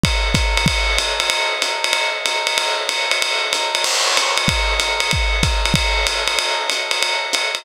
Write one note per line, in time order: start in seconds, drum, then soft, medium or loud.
0.04 kick medium
0.04 ride loud
0.34 kick medium
0.34 hi-hat pedal medium
0.34 ride medium
0.57 ride medium
0.66 kick medium
0.66 ride loud
0.98 hi-hat pedal medium
0.98 ride medium
1.20 ride medium
1.30 ride loud
1.62 hi-hat pedal medium
1.62 ride medium
1.84 ride medium
1.93 ride medium
2.26 hi-hat pedal medium
2.26 ride medium
2.47 ride medium
2.58 ride loud
2.89 hi-hat pedal medium
2.89 ride medium
3.11 ride medium
3.22 ride loud
3.53 hi-hat pedal medium
3.53 ride medium
3.75 ride medium
3.84 crash loud
3.84 ride medium
4.17 hi-hat pedal medium
4.17 ride medium
4.37 ride medium
4.48 kick medium
4.48 ride loud
4.80 hi-hat pedal medium
4.80 ride medium
5.00 ride medium
5.11 kick medium
5.11 ride loud
5.43 kick medium
5.43 hi-hat pedal medium
5.43 ride medium
5.65 ride medium
5.74 kick medium
5.74 ride loud
6.07 hi-hat pedal medium
6.07 ride medium
6.28 ride medium
6.39 ride loud
6.70 hi-hat pedal medium
6.70 ride medium
6.91 ride medium
7.03 ride medium
7.33 hi-hat pedal medium
7.33 ride medium
7.55 ride medium